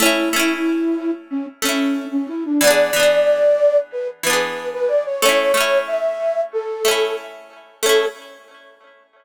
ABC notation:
X:1
M:4/4
L:1/16
Q:1/4=92
K:A
V:1 name="Flute"
E8 C z C3 C E D | d8 B z B3 B d c | c4 e4 A4 z4 | A4 z12 |]
V:2 name="Orchestral Harp"
[A,CE]2 [A,CE]8 [A,CE]6 | [E,B,DG]2 [E,B,DG]8 [E,B,DG]6 | [A,CE]2 [A,CE]8 [A,CE]6 | [A,CE]4 z12 |]